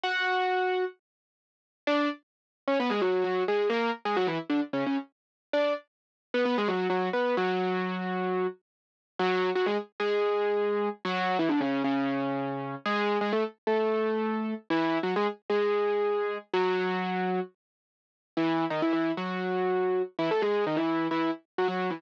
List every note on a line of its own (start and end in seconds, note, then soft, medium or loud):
0.03 0.84 F#4 loud
0.03 0.84 F#5 loud
1.87 2.08 D4 loud
1.87 2.08 D5 loud
2.68 2.78 C#4 medium
2.68 2.78 C#5 loud
2.80 2.91 B3 loud
2.80 2.91 B4 loud
2.90 3.01 G#3 loud
2.90 3.01 G#4 loud
3.02 3.23 F#3 medium
3.02 3.23 F#4 loud
3.24 3.43 F#3 medium
3.24 3.43 F#4 loud
3.48 3.68 G#3 medium
3.48 3.68 G#4 loud
3.70 3.90 A#3 loud
3.70 3.90 A#4 loud
4.05 4.16 G#3 medium
4.05 4.16 G#4 loud
4.17 4.27 F#3 loud
4.17 4.27 F#4 loud
4.27 4.38 E3 loud
4.27 4.38 E4 loud
4.50 4.60 D3 medium
4.50 4.60 D4 loud
4.73 4.84 C#3 medium
4.73 4.84 C#4 loud
4.86 4.97 C#3 medium
4.86 4.97 C#4 medium
5.53 5.73 D4 loud
5.53 5.73 D5 loud
6.34 6.45 B3 loud
6.34 6.45 B4 loud
6.45 6.56 B3 loud
6.45 6.56 B4 loud
6.58 6.69 G#3 loud
6.58 6.69 G#4 loud
6.68 6.87 F#3 medium
6.68 6.87 F#4 loud
6.90 7.09 F#3 medium
6.90 7.09 F#4 loud
7.13 7.35 B3 medium
7.13 7.35 B4 medium
7.37 8.47 F#3 loud
7.37 8.47 F#4 loud
9.19 9.50 F#3 loud
9.19 9.50 F#4 loud
9.55 9.66 F#3 loud
9.55 9.66 F#4 loud
9.66 9.77 G#3 loud
9.66 9.77 G#4 loud
10.00 10.89 G#3 medium
10.00 10.89 G#4 loud
11.05 11.37 F#3 loud
11.05 11.37 F#4 loud
11.39 11.50 E3 loud
11.39 11.50 E4 loud
11.49 11.60 D3 loud
11.49 11.60 D4 loud
11.61 11.82 C#3 medium
11.61 11.82 C#4 loud
11.84 12.75 C#3 medium
11.84 12.75 C#4 loud
12.85 13.18 G#3 loud
12.85 13.18 G#4 loud
13.21 13.32 G#3 medium
13.21 13.32 G#4 loud
13.33 13.43 A3 medium
13.33 13.43 A4 loud
13.67 14.54 A3 medium
13.67 14.54 A4 medium
14.70 14.98 E3 loud
14.70 14.98 E4 loud
15.03 15.14 F#3 medium
15.03 15.14 F#4 loud
15.16 15.27 G#3 loud
15.16 15.27 G#4 loud
15.50 16.38 G#3 medium
15.50 16.38 G#4 loud
16.54 17.40 F#3 loud
16.54 17.40 F#4 loud
18.37 18.65 E3 loud
18.37 18.65 E4 loud
18.70 18.81 D#3 medium
18.70 18.81 D#4 loud
18.82 18.92 E3 medium
18.82 18.92 E4 loud
18.93 19.11 E3 medium
18.93 19.11 E4 medium
19.17 20.02 F#3 medium
19.17 20.02 F#4 medium
20.19 20.29 E3 loud
20.19 20.29 E4 loud
20.31 20.42 A3 medium
20.31 20.42 A4 loud
20.42 20.64 G#3 medium
20.42 20.64 G#4 loud
20.67 20.77 D#3 medium
20.67 20.77 D#4 loud
20.76 21.07 E3 medium
20.76 21.07 E4 loud
21.11 21.30 E3 medium
21.11 21.30 E4 loud
21.58 21.67 F#3 medium
21.58 21.67 F#4 loud
21.68 21.90 F#3 medium
21.68 21.90 F#4 medium
21.90 22.01 E3 medium
21.90 22.01 E4 medium